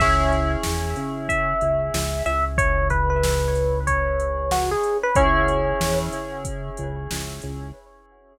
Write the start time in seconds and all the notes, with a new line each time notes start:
0.00 C#2 C#4 E4 G#4 E5, kick, crash
0.32 closed hi-hat
0.63 E2, snare
0.96 C#3, closed hi-hat
1.29 E5, kick, closed hi-hat
1.61 C#2, closed hi-hat
1.94 C#2, snare
2.26 C#2 E5, closed hi-hat
2.58 C#5, kick, closed hi-hat
2.90 B4, kick, closed hi-hat
3.10 B4
3.24 snare
3.55 closed hi-hat
3.87 C#5, kick, closed hi-hat
4.20 closed hi-hat
4.51 F#4, snare
4.71 G#4
4.83 closed hi-hat
5.03 B4
5.15 C#2 C#4 E4 G#4 C#5, kick, closed hi-hat
5.48 closed hi-hat
5.81 E2, snare
6.12 C#3, closed hi-hat
6.45 kick, closed hi-hat
6.77 C#2, closed hi-hat
7.11 C#2, snare
7.42 C#2, closed hi-hat